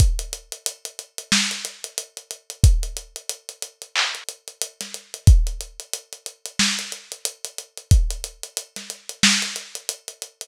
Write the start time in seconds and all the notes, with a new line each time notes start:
0.00 kick, closed hi-hat
0.19 closed hi-hat
0.33 closed hi-hat
0.52 closed hi-hat
0.66 closed hi-hat
0.85 closed hi-hat
0.99 closed hi-hat
1.18 closed hi-hat
1.32 snare
1.51 closed hi-hat
1.65 closed hi-hat
1.84 closed hi-hat
1.98 closed hi-hat
2.17 closed hi-hat
2.31 closed hi-hat
2.50 closed hi-hat
2.64 kick, closed hi-hat
2.83 closed hi-hat
2.97 closed hi-hat
3.16 closed hi-hat
3.29 closed hi-hat
3.49 closed hi-hat
3.62 closed hi-hat
3.82 closed hi-hat
3.96 clap
4.15 closed hi-hat
4.29 closed hi-hat
4.48 closed hi-hat
4.62 closed hi-hat
4.81 snare, closed hi-hat
4.94 closed hi-hat
5.14 closed hi-hat
5.27 kick, closed hi-hat
5.47 closed hi-hat
5.61 closed hi-hat
5.80 closed hi-hat
5.93 closed hi-hat
6.13 closed hi-hat
6.26 closed hi-hat
6.46 closed hi-hat
6.59 snare
6.79 closed hi-hat
6.92 closed hi-hat
7.12 closed hi-hat
7.25 closed hi-hat
7.45 closed hi-hat
7.58 closed hi-hat
7.77 closed hi-hat
7.91 kick, closed hi-hat
8.11 closed hi-hat
8.24 closed hi-hat
8.43 closed hi-hat
8.57 closed hi-hat
8.76 snare, closed hi-hat
8.90 closed hi-hat
9.09 closed hi-hat
9.23 snare
9.42 closed hi-hat
9.56 closed hi-hat
9.75 closed hi-hat
9.89 closed hi-hat
10.08 closed hi-hat
10.22 closed hi-hat
10.41 closed hi-hat